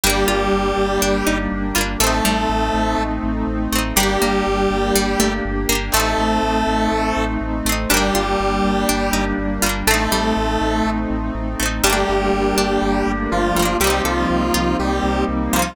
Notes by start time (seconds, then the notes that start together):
0.03 G1 G3 A#3 D4 G4
0.10 D4
0.28 G1 F4
0.52 G1
0.77 G1
1.02 G1 D4
1.27 G1 D#4
1.52 G1
1.75 G1 G3 A#3 F4
1.81 D4
2.00 A1 A3 C4 D#4 A4
2.07 D#4
2.25 A1 G3
2.49 A1
2.74 A1
2.98 A1
3.23 A1
3.47 A1
3.72 A1 A3 C4
3.78 D#4
3.96 G1 G3 A#3 D4 G4
4.03 G4
4.22 G1 A#3
4.47 G1
4.71 G1
4.95 G1 G3
5.20 G1 A3
5.45 G1
5.69 G1 A#3 D4
5.75 G4
5.92 A1 A3 C4 D#4 A4
5.97 C4 D#4
6.18 A1
6.43 A1
6.67 A1
6.92 A1
7.16 A1
7.41 A1
7.65 A1 A3 C4
7.72 D#4
7.89 G1 G3 A#3 D4 G4
7.94 A#3 D4
8.15 G1 F4
8.40 G1
8.64 G1
8.89 G1 D4
9.13 G1 D#4
9.38 G1
9.62 G1 G3 A#3 F4
9.69 D4
9.87 A1 A3 C4 D#4 A4
9.94 D#4
10.12 A1 G3
10.37 A1
10.61 A1
10.85 A1
11.10 A1
11.35 A1
11.60 A1 A3 C4
11.66 D#4
11.84 G1 G3 A3 A#3 D4 G4
11.90 A#3 D4
12.09 G1
12.33 G1
12.57 G1 D4
12.82 G1
13.07 G1
13.31 G1 F3 F4
13.56 G1 G3 A3
13.62 A#3 D4
13.80 C2 G3 A#3 C4 D#4 G4
13.84 A#3 C4
13.90 D#4
14.05 C2 F3 F4 A4
14.30 C2
14.54 C2 F4
14.79 C2 G3 G4
15.03 C2
15.28 C2
15.52 C2 F3 G3 A#3 F4
15.59 C4 D#4